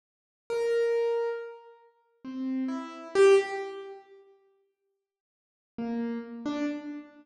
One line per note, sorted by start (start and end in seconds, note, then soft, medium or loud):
0.50 1.29 A#4 medium
2.25 2.64 C4 soft
2.68 3.08 E4 medium
3.15 3.35 G4 loud
5.78 6.18 A#3 medium
6.46 6.65 D4 medium